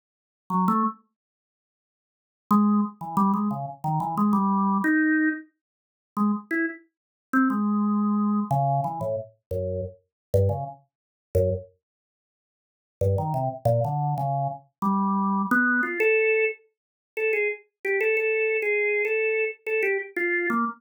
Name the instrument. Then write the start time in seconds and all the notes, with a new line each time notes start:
drawbar organ
0.50 F#3
0.68 A3
2.51 G#3
3.01 E3
3.17 G3
3.34 G#3
3.51 C#3
3.84 D#3
4.00 E3
4.18 G#3
4.33 G3
4.84 D#4
6.17 G#3
6.51 E4
7.33 C4
7.50 G#3
8.51 C#3
8.84 E3
9.01 A2
9.51 F#2
10.34 G2
10.49 C#3
11.35 F#2
13.01 G2
13.18 D#3
13.34 C3
13.65 A#2
13.85 D3
14.18 C#3
14.82 G3
15.51 B3
15.83 F4
16.00 A4
17.17 A4
17.33 G#4
17.85 G4
18.01 A4
18.17 A4
18.62 G#4
19.05 A4
19.67 A4
19.83 G4
20.17 F4
20.50 A#3